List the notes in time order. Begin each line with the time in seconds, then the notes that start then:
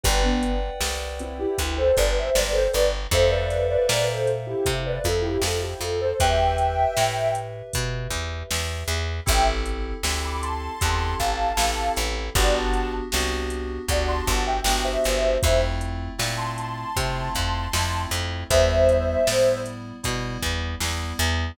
0.04 G1 G4 B4 D5 F#5 G5, kick, closed hi-hat
0.23 B3 D4
0.43 closed hi-hat
0.81 C2, snare
1.19 C4 E4, closed hi-hat
1.39 E4 G4
1.58 D2, kick, closed hi-hat
1.78 A4 C5
1.96 G1 B4 D5, kick, closed hi-hat
2.18 C5 E5
2.35 G1 B4 D5, snare
2.52 A4 C5
2.73 G1 B4 D5, closed hi-hat
3.11 F2 A4 C5 E5 F5, kick, closed hi-hat
3.29 B4 D5
3.50 snare, closed hi-hat
3.70 B4 D5
3.89 A#2, snare
4.10 A4 C5
4.27 closed hi-hat
4.47 E4 G4
4.66 C3, kick, closed hi-hat
4.86 B4 D5
5.04 F2 F4 A4, kick, closed hi-hat
5.22 E4 G4
5.42 F2 F4 A4, snare
5.62 E4 G4
5.80 F2 F4 A4, closed hi-hat
6.01 A4 C5
6.20 E2 G4 B4 E5 G5, kick, closed hi-hat
6.58 closed hi-hat
6.97 A2, snare
7.35 closed hi-hat
7.73 B2, kick, closed hi-hat
8.11 E2, kick, closed hi-hat
8.51 E2, snare
8.88 E2, closed hi-hat
9.26 A1 C4 E4 G4 A4 E5 G5, kick, closed hi-hat
9.66 closed hi-hat
10.03 D2 C4 E4 G4 A4, snare
10.25 B5 D6
10.42 A5 C6, closed hi-hat
10.81 E2 C4 E4 G4 A4, kick, closed hi-hat
11.19 A1 F5 A5, kick, closed hi-hat
11.57 A1 C4 E4 G4 A4, snare
11.97 A1, closed hi-hat
12.35 G1 B3 D4 F#4 G4 D5 F#5, kick, closed hi-hat
12.54 F#5 A5
12.74 closed hi-hat
13.12 C2 B3 D4 F#4 G4, snare
13.50 closed hi-hat
13.88 D2 B3 D4 F#4 G4 D5 F#5, kick, closed hi-hat
14.08 A5 C6
14.27 G1 F#5 A5, kick, closed hi-hat
14.47 E5 G5
14.64 G1 B3 D4 F#4 G4, snare
14.84 C5 E5
15.04 G1, closed hi-hat
15.42 F2 A3 C4 E4 F4 C5 E5, kick, closed hi-hat
15.81 closed hi-hat
16.18 A#2 A3 C4 E4 F4, snare
16.37 A5 C6
16.58 A5 C6, closed hi-hat
16.96 C3 A3 C4 E4 F4, kick, closed hi-hat
17.35 F2 A5 C6, kick, closed hi-hat
17.73 F2 A3 C4 E4 F4, snare
18.11 F2, closed hi-hat
18.50 E2 G3 B3 E4 C5 E5, kick, closed hi-hat
18.89 closed hi-hat
19.27 A2 G3 B3 E4, snare
19.66 closed hi-hat
20.03 B2 G3 B3 E4, kick, closed hi-hat
20.42 E2, kick, closed hi-hat
20.80 E2 G3 B3 E4, snare
21.19 E2, closed hi-hat